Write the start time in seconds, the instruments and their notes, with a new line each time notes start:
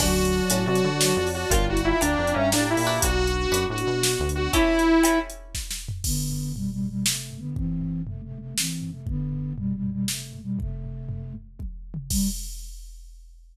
0.00 synth bass 1 D2, flute F#3, pizzicato strings C#4 D4 F#4 A4, lead 2 (sawtooth) F#4, pad 2 (warm) C#5 D5 F#5 A5, kick, crash
0.25 closed hi-hat
0.50 synth bass 1 A2, pizzicato strings C#4 D4 F#4 A4, closed hi-hat
0.66 synth bass 1 C3, lead 2 (sawtooth) F#4
0.75 closed hi-hat
0.84 synth bass 1 D3
1.01 flute F#3, snare
1.17 synth bass 1 F2
1.27 open hi-hat
1.34 lead 2 (sawtooth) F#4
1.50 synth bass 1 G1, pizzicato strings D4 F4 G4 A#4, lead 2 (sawtooth) F4, flute F4, pad 2 (warm) D5 F5 G5 A#5, kick, closed hi-hat
1.68 flute E4, lead 2 (sawtooth) F#4
1.77 closed hi-hat
1.84 lead 2 (sawtooth) E4, flute F4
2.01 synth bass 1 D2, pizzicato strings D4 F4 G4 A#4, lead 2 (sawtooth) D4, flute D5, closed hi-hat
2.19 synth bass 1 F2
2.27 closed hi-hat
2.34 synth bass 1 G2, lead 2 (sawtooth) C#4, flute E5
2.52 synth bass 1 A2, lead 2 (sawtooth) D4, flute G4, snare
2.70 lead 2 (sawtooth) E4
2.77 synth bass 1 A#2, open hi-hat
2.87 pizzicato strings D4 F#4 B4
3.02 synth bass 1 B1, pad 2 (warm) B3 D4 F#4, lead 2 (sawtooth) F#4, flute F#4, kick, closed hi-hat
3.27 closed hi-hat
3.51 synth bass 1 F#2, pizzicato strings D4 F#4 B4, closed hi-hat
3.70 synth bass 1 A2, lead 2 (sawtooth) F#4
3.78 closed hi-hat
3.87 synth bass 1 B2
4.03 flute F#4, snare
4.20 synth bass 1 D2
4.29 closed hi-hat
4.35 lead 2 (sawtooth) F#4
4.53 pizzicato strings C#4 E4 G4 A4, flute E4, lead 2 (sawtooth) E4, kick, closed hi-hat
4.79 closed hi-hat
5.03 pizzicato strings C#4 E4 G4 A4, closed hi-hat
5.30 closed hi-hat
5.55 kick, snare
5.71 snare
5.89 floor tom
6.04 flute D3 B3, kick, crash
6.31 floor tom
6.56 flute B2 G3, floor tom
6.72 flute B2 G3
6.81 floor tom
6.90 flute B2 G3
7.05 flute C3 A3, snare
7.31 floor tom
7.39 flute D3 B3
7.56 flute E3 C4, kick, floor tom
7.81 floor tom
8.07 flute C3 A3, floor tom
8.24 flute C3 A3
8.32 floor tom
8.40 flute C3 A3
8.58 flute E3 C4, snare
8.82 floor tom
8.91 flute C3 A3
9.07 flute D3 B3, kick, floor tom
9.33 floor tom
9.58 flute B2 G3, floor tom
9.75 flute B2 G3
9.83 floor tom
9.92 flute B2 G3
10.08 flute C3 A3, snare
10.33 floor tom
10.43 flute B2 G3
10.59 flute C3 A3, kick, floor tom
10.84 floor tom
11.09 floor tom
11.35 floor tom
11.59 kick, high tom
11.94 mid tom
12.10 flute G3, kick, crash